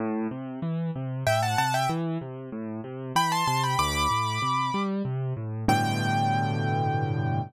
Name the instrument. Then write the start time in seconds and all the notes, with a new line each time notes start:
acoustic grand piano
0.00 A2
0.31 C3
0.62 E3
0.95 C3
1.26 A2 E5 G5
1.42 F#5 A5
1.58 C3 F#5 A5
1.74 E5 G5
1.89 E3
2.21 C3
2.52 A2
2.84 C3
3.15 E3 G5 B5
3.32 A5 C6
3.47 C3 A5 C6
3.63 G5 B5
3.79 D2 B5 D6
4.10 A2
4.42 C3
4.74 G3
5.05 C3
5.37 A2
5.68 G2 A2 B2 D3 G5